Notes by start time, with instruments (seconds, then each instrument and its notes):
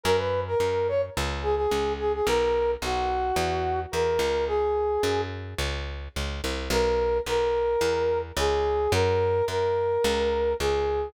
0.03 electric bass (finger) F#2, brass section A#4
0.17 brass section B4
0.47 brass section A#4
0.60 electric bass (finger) F#2
0.88 brass section C#5
1.17 electric bass (finger) C#2
1.42 brass section G#4
1.56 brass section G#4
1.71 electric bass (finger) C#2
1.99 brass section G#4
2.14 brass section G#4
2.26 electric bass (finger) B1, brass section A#4
2.82 electric bass (finger) B1, brass section F#4
3.36 electric bass (finger) E2
3.92 electric bass (finger) E2, brass section A#4
4.19 electric bass (finger) C#2
4.47 brass section G#4
5.03 electric bass (finger) F#2
5.58 electric bass (finger) C#2
6.16 electric bass (finger) C#2
6.44 electric bass (finger) C2
6.70 electric bass (finger) B1, brass section A#4
7.26 electric bass (finger) B1, brass section A#4
7.81 electric bass (finger) E2
8.36 electric bass (finger) C#2, brass section G#4
8.92 electric bass (finger) F#2, brass section A#4
9.48 electric bass (finger) F#2, brass section A#4
10.04 electric bass (finger) C#2
10.60 electric bass (finger) C#2, brass section G#4